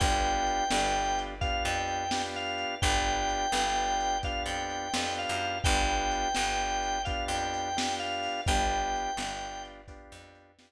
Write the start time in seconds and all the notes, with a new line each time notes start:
0.00 G1 B3 D4 F4 G4 G5, kick, crash
0.47 closed hi-hat
0.70 G1 B3 D4 F4 G4, snare
1.19 closed hi-hat
1.41 B3 D4 F4 G4 F5, kick, closed hi-hat
1.65 F2 G5
1.88 closed hi-hat
2.11 B3 D4 F4 G4, snare
2.36 F5
2.58 closed hi-hat
2.82 G1 B3 D4 F4 G4 G5, kick, closed hi-hat
3.29 closed hi-hat
3.52 G1 B3 D4 F4 G4, snare
4.00 closed hi-hat
4.23 B3 D4 F4 G4 F5, kick, closed hi-hat
4.46 F2 G5
4.70 closed hi-hat
4.94 F2 B3 D4 F4 G4, snare
5.19 F5
5.29 F#2
5.41 closed hi-hat
5.64 G1 B3 D4 F4 G4 G5, kick, closed hi-hat
6.11 closed hi-hat
6.35 G1 B3 D4 F4 G4, snare
6.83 closed hi-hat
7.05 B3 D4 F4 G4 F5, kick, closed hi-hat
7.28 F2 G5
7.54 closed hi-hat
7.77 B3 D4 F4 G4, snare
8.00 F5
8.23 open hi-hat
8.46 G1 B3 D4 F4 G4 G5, kick, closed hi-hat
8.96 closed hi-hat
9.17 G1 B3 D4 F4 G4, snare
9.65 closed hi-hat
9.88 B3 D4 F4 G4, kick, closed hi-hat
10.12 F2
10.35 closed hi-hat
10.59 B3 D4 F4 G4, snare